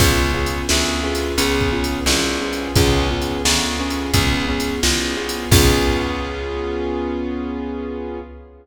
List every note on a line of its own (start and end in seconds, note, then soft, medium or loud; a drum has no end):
0.00 0.62 C#2 loud
0.00 0.32 B3 medium
0.00 0.32 C#4 medium
0.00 0.32 F4 medium
0.00 0.32 G#4 medium
0.00 kick medium
0.00 crash medium
0.34 0.66 B3 medium
0.34 0.66 C#4 medium
0.34 0.66 F4 medium
0.34 0.66 G#4 medium
0.46 closed hi-hat medium
0.69 1.32 D2 loud
0.69 1.01 B3 medium
0.69 1.01 C#4 medium
0.69 1.01 F4 medium
0.69 1.01 G#4 medium
0.69 snare loud
1.03 1.35 B3 medium
1.03 1.35 C#4 medium
1.03 1.35 F4 medium
1.03 1.35 G#4 medium
1.15 closed hi-hat medium
1.38 2.00 C#2 loud
1.38 1.70 B3 medium
1.38 1.70 C#4 medium
1.38 1.70 F4 medium
1.38 1.70 G#4 medium
1.38 closed hi-hat medium
1.61 kick medium
1.72 2.04 B3 medium
1.72 2.04 C#4 medium
1.72 2.04 F4 medium
1.72 2.04 G#4 medium
1.84 closed hi-hat medium
2.06 2.68 C2 loud
2.06 2.39 B3 medium
2.06 2.39 C#4 medium
2.06 2.39 F4 medium
2.06 2.39 G#4 medium
2.06 snare loud
2.41 2.73 B3 medium
2.41 2.73 C#4 medium
2.41 2.73 F4 medium
2.41 2.73 G#4 medium
2.53 closed hi-hat medium
2.76 3.38 C#2 loud
2.76 3.08 B3 medium
2.76 3.08 C#4 loud
2.76 3.08 F4 medium
2.76 3.08 G#4 medium
2.76 kick medium
2.76 closed hi-hat medium
3.10 3.42 B3 medium
3.10 3.42 C#4 medium
3.10 3.42 F4 medium
3.10 3.42 G#4 medium
3.22 closed hi-hat medium
3.45 4.07 D2 medium
3.45 3.77 B3 medium
3.45 3.77 C#4 medium
3.45 3.77 F4 medium
3.45 3.77 G#4 medium
3.45 snare loud
3.79 4.11 B3 medium
3.79 4.11 C#4 medium
3.79 4.11 F4 medium
3.79 4.11 G#4 medium
3.90 closed hi-hat medium
4.14 4.76 C#2 loud
4.14 4.46 B3 medium
4.14 4.46 C#4 medium
4.14 4.46 F4 medium
4.14 4.46 G#4 medium
4.14 kick medium
4.14 closed hi-hat medium
4.48 4.80 B3 medium
4.48 4.80 C#4 medium
4.48 4.80 F4 medium
4.48 4.80 G#4 medium
4.60 closed hi-hat medium
4.83 5.45 C2 medium
4.83 5.15 B3 medium
4.83 5.15 C#4 medium
4.83 5.15 F4 medium
4.83 5.15 G#4 medium
4.83 snare loud
5.17 5.49 B3 medium
5.17 5.49 C#4 medium
5.17 5.49 F4 medium
5.17 5.49 G#4 medium
5.29 closed hi-hat medium
5.51 8.19 C#2 loud
5.51 8.20 B3 loud
5.51 8.20 C#4 medium
5.51 8.20 F4 loud
5.51 8.20 G#4 medium
5.51 kick loud
5.51 crash loud